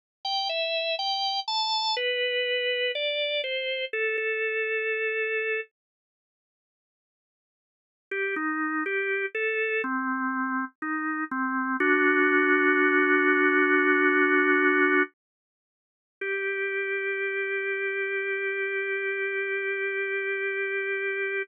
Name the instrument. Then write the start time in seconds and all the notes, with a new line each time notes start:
drawbar organ
0.25 G5
0.49 E5
0.99 G5
1.48 A5
1.97 B4
2.95 D5
3.44 C5
3.93 A4
4.18 A4
8.11 G4
8.36 D#4
8.86 G4
9.35 A4
9.84 C4
10.82 D#4
11.31 C4
11.80 D4 F#4
16.21 G4